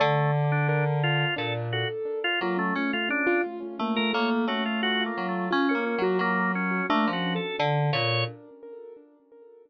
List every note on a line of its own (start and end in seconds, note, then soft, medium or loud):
0.00 1.25 D3 loud
0.00 0.31 A3 medium
0.00 0.19 D5 medium
0.25 0.44 D5 medium
0.44 0.65 D5 medium
0.52 0.67 D4 medium
0.69 0.84 D4 medium
0.69 1.00 A#4 medium
1.03 1.34 F4 loud
1.36 1.85 A#2 medium
1.36 1.67 D4 medium
1.36 1.53 A4 medium
1.73 1.88 F#4 medium
1.73 2.20 A4 medium
2.24 2.40 F4 loud
2.41 2.72 F#3 medium
2.41 2.57 A#3 medium
2.41 2.58 F4 medium
2.57 2.74 A3 medium
2.57 2.73 C#4 medium
2.75 2.93 A3 medium
2.75 2.91 C#4 medium
2.93 3.09 A3 medium
2.93 3.09 F4 medium
3.09 3.25 C#4 medium
3.09 3.41 D4 loud
3.27 3.42 F4 loud
3.44 3.59 F4 medium
3.60 3.76 C#4 medium
3.79 4.10 A3 medium
3.79 3.96 A#3 medium
3.96 4.13 A3 medium
3.96 4.12 A#4 medium
4.13 4.44 A3 loud
4.13 4.45 A#3 medium
4.13 4.29 C#5 medium
4.47 5.09 A3 medium
4.47 4.63 C#4 medium
4.47 4.64 F#4 medium
4.66 4.81 F4 medium
4.83 4.98 F4 medium
4.83 5.03 F#4 loud
5.00 5.47 F4 medium
5.06 5.27 A#3 medium
5.17 5.48 F#3 medium
5.29 5.49 A3 soft
5.51 5.73 C#4 loud
5.51 5.66 F4 medium
5.69 5.84 C#4 medium
5.69 6.02 A#4 medium
5.75 5.95 A#3 medium
5.86 6.02 C#4 medium
5.98 6.18 F#3 medium
5.98 6.18 F#4 loud
6.03 6.19 A#3 medium
6.19 6.81 F#3 medium
6.19 6.52 A#3 loud
6.55 6.86 C#4 medium
6.90 7.05 A3 loud
6.90 7.10 A#3 medium
6.90 7.10 D4 loud
7.07 7.38 F3 medium
7.13 7.34 C#4 soft
7.13 7.33 F#4 medium
7.35 7.56 A4 medium
7.59 7.90 D3 loud
7.93 8.24 A#2 medium
7.93 8.25 A#4 medium
7.93 8.24 C#5 loud